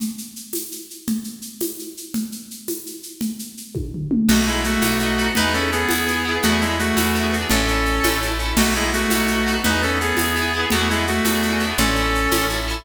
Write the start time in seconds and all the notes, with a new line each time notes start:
0.00 low conga, shaker
0.18 shaker
0.36 shaker
0.53 tambourine, high conga, shaker
0.72 shaker
0.90 shaker
1.07 low conga, shaker
1.24 shaker
1.42 shaker
1.61 tambourine, high conga, shaker
1.79 shaker
1.97 shaker
2.14 low conga, shaker
2.32 shaker
2.51 shaker
2.68 tambourine, high conga, shaker
2.86 shaker
3.03 shaker
3.21 low conga, shaker
3.39 shaker
3.57 shaker
3.75 kick, high tom
3.94 floor tom
4.11 mid tom
4.28 B1 A3 B3 D#4 F#4, crash, low conga, shaker
4.35 F#4
4.46 G#3 B3 D#4 E4, shaker
4.53 F#4
4.64 A3 F#4, shaker
4.82 B1 B3 D#4, tambourine, high conga, shaker
4.88 F#4
4.99 B3, shaker
5.03 D#4 F#4
5.18 B3 D#4, shaker
5.24 F#4
5.35 E2 B3 D#4 E4 B4, low conga, shaker
5.42 G#4
5.53 B3 C#4 E4 A4, shaker
5.60 G#4
5.72 B3 G#4, shaker
5.89 E2 B3 E4, tambourine, high conga, shaker
5.95 G#4
6.07 B3 E4, shaker
6.13 G#4
6.25 B3 E4
6.31 G#4
6.42 E2 A3 B3 D4 F#4, low conga, shaker
6.49 E4 G#4
6.61 G#3 B3 D4 E4, shaker
6.67 E4 G#4
6.79 A3 F#4, shaker
6.96 E2 B3 D4, tambourine, high conga, shaker
7.03 E4 G#4
7.14 B3 D4, shaker
7.20 E4 G#4
7.32 B3 D4, shaker
7.38 E4 G#4
7.49 A1 C#4 D4 E4 A4, low conga, shaker
7.56 A4
7.68 D4 E4, shaker
7.74 A4
7.85 shaker
8.04 A1 C#4 E4, tambourine, high conga, shaker
8.10 A4
8.21 C#4 E4, shaker
8.28 A4
8.39 C#4 E4, shaker
8.45 A4
8.57 B1 A3 B3 D#4 F#4, crash, low conga, shaker
8.63 F#4
8.75 G#3 B3 D#4 E4, shaker
8.81 F#4
8.93 A3 F#4, shaker
9.10 B1 B3 D#4, tambourine, high conga, shaker
9.17 F#4
9.27 B3, shaker
9.32 D#4 F#4
9.46 B3 D#4, shaker
9.53 F#4
9.64 E2 B3 D#4 E4 B4, low conga, shaker
9.70 G#4
9.82 B3 C#4 E4 A4, shaker
9.88 G#4
10.00 B3 G#4, shaker
10.17 E2 B3, tambourine, high conga, shaker
10.21 E4 G#4
10.36 B3 E4, shaker
10.42 G#4
10.54 B3 E4
10.60 G#4
10.70 E2 A3 B3 F#4, low conga, shaker
10.75 D4 E4
10.81 G#4
10.89 G#3 B3 D4 E4, shaker
10.95 E4 G#4
11.07 A3 F#4, shaker
11.25 E2 B3 D4, tambourine, high conga, shaker
11.31 E4 G#4
11.42 B3 D4, shaker
11.49 E4 G#4
11.59 B3, shaker
11.64 D4 E4
11.70 G#4
11.78 A1 C#4 D4 E4 A4, low conga, shaker
11.85 A4
11.95 D4, shaker
12.00 E4 A4
12.15 shaker
12.32 A1 C#4 E4, tambourine, high conga, shaker
12.38 A4
12.49 C#4 E4, shaker
12.56 A4
12.68 C#4 E4, shaker
12.74 A4